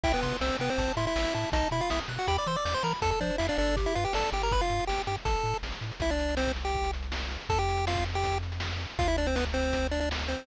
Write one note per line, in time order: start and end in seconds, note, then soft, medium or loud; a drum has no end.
0.03 0.14 C2 medium
0.03 0.12 E4 medium
0.03 0.12 E5 medium
0.03 0.21 G5 loud
0.03 kick loud
0.03 crash loud
0.14 0.37 B3 medium
0.14 0.37 B4 medium
0.14 closed hi-hat medium
0.23 0.33 C3 medium
0.23 0.39 C6 medium
0.23 kick medium
0.23 closed hi-hat medium
0.32 closed hi-hat medium
0.41 0.51 C2 medium
0.41 0.57 C4 medium
0.41 0.57 C5 medium
0.41 0.58 E6 medium
0.41 snare loud
0.50 closed hi-hat medium
0.59 0.69 C3 medium
0.59 0.70 B3 medium
0.59 0.70 B4 medium
0.59 0.76 G5 medium
0.59 closed hi-hat medium
0.69 0.92 C4 medium
0.69 0.92 C5 medium
0.69 closed hi-hat medium
0.78 0.88 A1 loud
0.78 0.95 A5 medium
0.78 kick loud
0.78 closed hi-hat loud
0.88 closed hi-hat medium
0.97 1.07 A2 medium
0.97 1.06 E4 medium
0.97 1.06 E5 medium
0.97 1.14 C6 medium
0.97 closed hi-hat medium
1.07 1.34 E4 medium
1.07 1.34 E5 medium
1.07 closed hi-hat medium
1.16 1.26 A1 medium
1.16 1.33 E6 medium
1.16 snare loud
1.25 closed hi-hat medium
1.34 1.45 A2 medium
1.34 1.50 E4 medium
1.34 1.50 E5 medium
1.34 1.51 A5 medium
1.34 closed hi-hat medium
1.44 closed hi-hat medium
1.52 1.63 B1 loud
1.52 1.68 D#4 medium
1.52 1.68 D#5 medium
1.52 1.70 A5 medium
1.52 kick loud
1.52 closed hi-hat loud
1.63 closed hi-hat medium
1.71 1.81 B2 medium
1.71 1.81 E4 medium
1.71 1.81 E5 medium
1.71 1.89 B5 medium
1.71 closed hi-hat medium
1.80 1.90 F4 medium
1.80 1.90 F5 medium
1.80 closed hi-hat medium
1.90 2.01 B1 medium
1.90 2.00 E4 medium
1.90 2.00 E5 medium
1.90 2.07 D#6 medium
1.90 snare loud
1.99 closed hi-hat medium
2.08 2.18 B2 medium
2.08 2.26 F#6 medium
2.08 closed hi-hat loud
2.18 2.27 F#4 medium
2.18 2.27 F#5 medium
2.18 closed hi-hat medium
2.27 2.38 E2 medium
2.27 2.37 G4 medium
2.27 2.37 G5 medium
2.27 2.44 B5 loud
2.27 kick medium
2.27 closed hi-hat loud
2.38 2.47 D5 medium
2.38 2.47 D6 medium
2.38 closed hi-hat medium
2.46 2.57 E3 medium
2.46 2.56 C5 medium
2.46 2.56 C6 medium
2.46 2.63 E6 medium
2.46 closed hi-hat medium
2.56 2.65 D5 medium
2.56 2.65 D6 medium
2.56 closed hi-hat medium
2.65 2.75 E2 medium
2.65 2.74 D5 medium
2.65 2.74 D6 medium
2.65 2.82 G6 medium
2.65 snare loud
2.74 2.83 C5 medium
2.74 2.83 C6 medium
2.74 closed hi-hat medium
2.83 2.93 E3 medium
2.83 2.93 A#4 medium
2.83 2.93 A#5 medium
2.83 3.00 B5 medium
2.83 closed hi-hat medium
2.93 open hi-hat medium
3.02 3.13 F2 medium
3.02 3.10 A4 medium
3.02 3.19 A4 loud
3.02 3.10 A5 medium
3.02 kick loud
3.02 closed hi-hat loud
3.11 3.20 A4 medium
3.11 3.20 A5 medium
3.11 closed hi-hat medium
3.20 3.31 F3 medium
3.20 3.36 D4 medium
3.20 3.38 C5 medium
3.20 3.36 D5 medium
3.20 kick medium
3.20 closed hi-hat medium
3.30 closed hi-hat medium
3.38 3.50 F2 medium
3.38 3.47 E4 medium
3.38 3.47 E5 medium
3.38 3.56 F5 medium
3.38 snare loud
3.49 3.58 D4 medium
3.49 3.58 D5 medium
3.49 closed hi-hat medium
3.58 3.87 G1 loud
3.58 3.76 D4 medium
3.58 3.75 A4 medium
3.58 3.76 D5 medium
3.58 closed hi-hat medium
3.67 closed hi-hat medium
3.76 3.93 G4 medium
3.76 kick loud
3.76 closed hi-hat loud
3.86 3.95 E4 medium
3.86 3.95 E5 medium
3.86 closed hi-hat medium
3.95 4.06 G2 medium
3.95 4.04 F4 medium
3.95 4.12 B4 medium
3.95 4.04 F5 medium
3.95 closed hi-hat medium
4.05 4.13 G4 medium
4.05 4.13 G5 medium
4.05 closed hi-hat medium
4.13 4.24 G1 medium
4.13 4.30 A4 medium
4.13 4.31 D5 medium
4.13 4.30 A5 medium
4.13 snare loud
4.24 closed hi-hat medium
4.32 4.61 G1 medium
4.32 4.49 G4 medium
4.32 4.42 G4 medium
4.32 4.42 G5 medium
4.32 closed hi-hat medium
4.42 4.52 A#4 medium
4.42 4.52 A#5 medium
4.42 closed hi-hat medium
4.51 4.61 B4 medium
4.51 4.61 B5 medium
4.51 kick loud
4.51 closed hi-hat loud
4.61 4.85 F4 medium
4.61 4.85 F5 medium
4.61 closed hi-hat medium
4.70 4.80 G2 medium
4.70 closed hi-hat medium
4.80 closed hi-hat medium
4.87 4.99 G1 medium
4.87 5.02 G4 medium
4.87 5.02 G5 medium
4.87 snare loud
4.98 closed hi-hat medium
5.06 5.17 G2 medium
5.06 5.16 G4 medium
5.06 5.16 G5 medium
5.06 closed hi-hat medium
5.16 closed hi-hat medium
5.25 5.36 A1 medium
5.25 5.58 A4 medium
5.25 5.58 A5 medium
5.25 kick loud
5.25 closed hi-hat loud
5.36 closed hi-hat medium
5.44 5.54 A2 medium
5.44 closed hi-hat medium
5.54 closed hi-hat medium
5.63 5.73 A1 medium
5.63 snare loud
5.72 closed hi-hat medium
5.81 5.91 A2 medium
5.81 closed hi-hat medium
5.92 closed hi-hat medium
6.00 7.37 C2 medium
6.00 6.10 E4 medium
6.00 6.10 E5 medium
6.00 kick loud
6.00 closed hi-hat loud
6.09 6.35 D4 medium
6.09 6.35 D5 medium
6.09 closed hi-hat medium
6.19 closed hi-hat medium
6.29 closed hi-hat medium
6.37 6.52 C4 medium
6.37 6.52 C5 medium
6.37 snare loud
6.47 kick medium
6.47 closed hi-hat medium
6.56 closed hi-hat medium
6.65 6.91 G4 medium
6.65 6.91 G5 medium
6.65 closed hi-hat medium
6.75 kick loud
6.84 closed hi-hat medium
6.93 closed hi-hat medium
7.02 closed hi-hat medium
7.12 snare loud
7.21 closed hi-hat medium
7.31 closed hi-hat medium
7.41 closed hi-hat medium
7.49 8.86 F2 medium
7.49 7.58 A4 medium
7.49 7.58 A5 medium
7.49 kick loud
7.49 closed hi-hat loud
7.58 7.85 G4 medium
7.58 7.85 G5 medium
7.58 closed hi-hat medium
7.69 closed hi-hat medium
7.77 closed hi-hat medium
7.87 8.05 F4 medium
7.87 8.05 F5 medium
7.87 snare loud
7.95 kick loud
7.95 closed hi-hat medium
8.05 closed hi-hat medium
8.14 8.38 G4 medium
8.14 8.38 G5 medium
8.14 closed hi-hat medium
8.24 kick medium
8.24 closed hi-hat loud
8.32 closed hi-hat medium
8.43 closed hi-hat medium
8.52 closed hi-hat medium
8.60 snare loud
8.71 closed hi-hat medium
8.81 closed hi-hat medium
8.90 closed hi-hat medium
8.99 10.36 D2 medium
8.99 9.07 F4 medium
8.99 9.07 F5 medium
8.99 kick loud
8.99 closed hi-hat loud
9.08 9.17 E4 medium
9.08 9.17 E5 medium
9.08 closed hi-hat medium
9.17 9.27 D4 medium
9.17 9.27 D5 medium
9.17 closed hi-hat medium
9.26 9.36 C4 medium
9.26 9.36 C5 medium
9.26 closed hi-hat medium
9.36 9.45 B3 medium
9.36 9.45 B4 medium
9.36 snare loud
9.45 kick medium
9.45 closed hi-hat medium
9.53 9.87 C4 medium
9.53 9.87 C5 medium
9.53 closed hi-hat medium
9.64 closed hi-hat medium
9.73 kick medium
9.73 closed hi-hat loud
9.83 closed hi-hat medium
9.91 10.00 D4 medium
9.91 10.00 D5 medium
9.91 closed hi-hat medium
10.00 10.09 D4 medium
10.00 10.09 D5 medium
10.00 closed hi-hat medium
10.11 snare loud
10.19 closed hi-hat medium
10.28 10.46 C4 medium
10.28 10.46 C5 medium
10.28 closed hi-hat medium
10.38 closed hi-hat medium